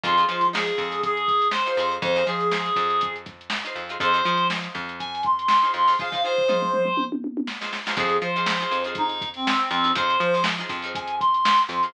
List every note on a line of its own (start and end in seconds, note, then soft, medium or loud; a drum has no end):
0.04 0.25 F2 loud
0.04 0.15 D#4 medium
0.04 0.47 F4 loud
0.04 0.15 F4 medium
0.04 0.15 G#4 medium
0.04 0.15 C5 medium
0.04 kick loud
0.04 closed hi-hat loud
0.17 0.26 D#4 medium
0.17 0.26 F4 medium
0.17 0.26 G#4 medium
0.17 0.26 C5 medium
0.17 closed hi-hat medium
0.29 0.71 F3 medium
0.29 0.49 D#4 medium
0.29 0.49 F4 medium
0.29 0.49 G#4 medium
0.29 0.49 C5 medium
0.29 closed hi-hat medium
0.41 closed hi-hat medium
0.53 0.94 D#4 medium
0.53 0.94 F4 medium
0.53 1.01 G#4 loud
0.53 0.94 G#4 medium
0.53 0.94 C5 medium
0.53 snare loud
0.67 closed hi-hat medium
0.78 1.63 F2 medium
0.78 kick medium
0.78 snare medium
0.78 closed hi-hat medium
0.91 snare soft
0.91 closed hi-hat medium
1.03 1.48 G#4 loud
1.03 kick loud
1.03 closed hi-hat loud
1.17 closed hi-hat medium
1.28 kick medium
1.28 closed hi-hat medium
1.42 closed hi-hat medium
1.51 1.95 C5 loud
1.51 snare loud
1.66 1.77 D#4 medium
1.66 1.77 F4 medium
1.66 1.77 G#4 medium
1.66 1.77 C5 medium
1.66 closed hi-hat medium
1.77 1.99 F2 medium
1.77 2.13 D#4 medium
1.77 2.13 F4 medium
1.77 2.13 G#4 medium
1.77 2.13 C5 medium
1.77 closed hi-hat medium
1.91 closed hi-hat medium
2.02 2.23 F2 loud
2.02 2.26 C5 medium
2.02 kick loud
2.02 closed hi-hat loud
2.16 2.25 D#4 medium
2.16 2.25 F4 medium
2.16 2.25 G#4 medium
2.16 2.25 C5 medium
2.16 closed hi-hat medium
2.27 2.70 F3 medium
2.27 2.47 D#4 medium
2.27 2.47 F4 medium
2.27 3.14 G#4 medium
2.27 2.47 G#4 medium
2.27 2.47 C5 medium
2.27 closed hi-hat medium
2.40 closed hi-hat medium
2.51 2.92 D#4 medium
2.51 2.92 F4 medium
2.51 2.92 G#4 medium
2.51 2.92 C5 medium
2.51 snare loud
2.66 closed hi-hat medium
2.76 3.62 F2 medium
2.76 kick medium
2.76 snare soft
2.76 closed hi-hat medium
2.90 closed hi-hat medium
3.01 kick loud
3.01 closed hi-hat loud
3.16 closed hi-hat medium
3.26 kick loud
3.26 snare soft
3.26 closed hi-hat medium
3.41 closed hi-hat medium
3.50 snare loud
3.65 3.84 D#4 medium
3.65 3.84 F4 medium
3.65 3.84 G#4 medium
3.65 3.84 C5 medium
3.65 closed hi-hat loud
3.75 3.97 F2 medium
3.75 closed hi-hat medium
3.89 3.98 D#4 medium
3.89 3.98 F4 medium
3.89 3.98 G#4 medium
3.89 3.98 C5 medium
3.89 closed hi-hat medium
4.00 4.22 F2 medium
4.00 4.11 D#4 medium
4.00 4.11 F4 medium
4.00 4.11 G#4 medium
4.00 4.47 C5 loud
4.00 4.11 C5 medium
4.00 kick loud
4.00 closed hi-hat loud
4.14 4.23 D#4 medium
4.14 4.23 F4 medium
4.14 4.23 G#4 medium
4.14 4.23 C5 medium
4.14 closed hi-hat medium
4.25 4.68 F3 medium
4.25 4.46 D#4 medium
4.25 4.46 F4 medium
4.25 4.46 G#4 medium
4.25 4.46 C5 medium
4.25 closed hi-hat medium
4.38 closed hi-hat medium
4.50 4.91 D#4 medium
4.50 4.91 F4 medium
4.50 4.91 G#4 medium
4.50 4.91 C5 medium
4.50 snare loud
4.62 snare soft
4.62 closed hi-hat medium
4.75 5.60 F2 medium
4.75 kick medium
4.75 closed hi-hat medium
4.89 closed hi-hat medium
4.99 5.22 G#5 loud
4.99 kick medium
4.99 closed hi-hat loud
5.15 closed hi-hat medium
5.23 5.71 C6 loud
5.23 kick loud
5.23 closed hi-hat medium
5.39 closed hi-hat medium
5.48 snare loud
5.62 5.82 D#4 medium
5.62 5.82 F4 medium
5.62 5.82 G#4 medium
5.62 5.82 C5 medium
5.62 closed hi-hat medium
5.74 5.95 F2 medium
5.74 5.98 C6 medium
5.74 closed hi-hat medium
5.87 5.96 D#4 medium
5.87 5.96 F4 medium
5.87 5.96 G#4 medium
5.87 5.96 C5 medium
5.87 open hi-hat medium
5.99 6.10 D#4 medium
5.99 6.10 F4 medium
5.99 6.10 G#4 medium
5.99 6.10 C5 medium
5.99 6.23 F5 loud
5.99 kick loud
5.99 floor tom medium
6.12 6.21 D#4 medium
6.12 6.21 F4 medium
6.12 6.21 G#4 medium
6.12 6.21 C5 medium
6.12 floor tom loud
6.24 6.44 D#4 medium
6.24 6.44 F4 medium
6.24 6.44 G#4 medium
6.24 7.04 C5 loud
6.24 6.44 C5 medium
6.38 floor tom medium
6.48 6.89 D#4 medium
6.48 6.89 F4 medium
6.48 6.89 G#4 medium
6.48 6.89 C5 medium
6.48 mid tom loud
6.62 mid tom medium
6.73 mid tom medium
6.85 mid tom medium
6.97 high tom loud
7.12 high tom loud
7.24 high tom medium
7.37 high tom loud
7.47 snare loud
7.61 7.80 D#4 medium
7.61 7.80 F4 medium
7.61 7.80 G#4 medium
7.61 7.80 C5 medium
7.61 snare loud
7.73 snare loud
7.86 7.95 D#4 medium
7.86 7.95 F4 medium
7.86 7.95 G#4 medium
7.86 7.95 C5 medium
7.86 snare loud
7.96 8.18 F2 loud
7.96 8.28 D#4 medium
7.96 8.28 F4 medium
7.96 8.16 G#4 loud
7.96 8.28 G#4 medium
7.96 kick loud
7.96 closed hi-hat loud
8.00 8.28 C5 medium
8.09 closed hi-hat medium
8.22 8.65 F3 medium
8.22 8.83 C5 medium
8.22 closed hi-hat loud
8.36 8.55 D#4 medium
8.36 8.55 F4 medium
8.36 8.55 G#4 medium
8.36 8.55 C5 medium
8.36 closed hi-hat medium
8.46 snare loud
8.60 8.80 D#4 medium
8.60 8.80 F4 medium
8.60 8.80 G#4 medium
8.60 8.80 C5 medium
8.60 closed hi-hat medium
8.71 9.57 F2 medium
8.71 closed hi-hat loud
8.84 9.24 D#4 medium
8.84 9.24 F4 medium
8.84 9.24 G#4 medium
8.84 9.24 C5 medium
8.84 closed hi-hat medium
8.95 9.29 D#4 loud
8.95 kick loud
8.95 closed hi-hat loud
9.09 snare soft
9.09 closed hi-hat medium
9.21 kick loud
9.21 closed hi-hat loud
9.34 9.69 C4 medium
9.34 closed hi-hat medium
9.47 snare loud
9.60 closed hi-hat medium
9.70 9.92 F2 medium
9.70 9.92 C4 loud
9.70 snare soft
9.70 closed hi-hat loud
9.84 9.93 D#4 medium
9.84 9.93 F4 medium
9.84 9.93 G#4 medium
9.84 9.93 C5 medium
9.84 closed hi-hat medium
9.95 10.17 F2 medium
9.95 10.26 D#4 medium
9.95 10.26 F4 loud
9.95 10.26 G#4 medium
9.95 10.43 C5 loud
9.95 10.26 C5 medium
9.95 kick loud
9.95 closed hi-hat loud
10.10 closed hi-hat loud
10.20 10.63 F3 medium
10.20 closed hi-hat loud
10.34 10.53 D#4 medium
10.34 10.53 F4 medium
10.34 10.53 G#4 medium
10.34 10.53 C5 medium
10.34 closed hi-hat medium
10.44 snare loud
10.58 10.78 D#4 medium
10.58 10.78 F4 medium
10.58 10.78 G#4 medium
10.58 10.78 C5 medium
10.58 closed hi-hat medium
10.69 11.55 F2 medium
10.69 kick loud
10.69 closed hi-hat loud
10.82 11.22 D#4 medium
10.82 11.22 F4 medium
10.82 11.22 G#4 medium
10.82 11.22 C5 medium
10.82 closed hi-hat medium
10.95 11.15 G#5 loud
10.95 kick loud
10.95 closed hi-hat loud
11.07 closed hi-hat loud
11.20 11.62 C6 loud
11.20 kick loud
11.20 closed hi-hat loud
11.34 closed hi-hat medium
11.45 snare loud
11.58 snare soft
11.58 closed hi-hat medium
11.67 11.90 F2 medium
11.67 11.90 C6 medium
11.67 closed hi-hat loud
11.83 11.92 D#4 medium
11.83 11.92 F4 medium
11.83 11.92 G#4 medium
11.83 11.92 C5 medium
11.83 closed hi-hat medium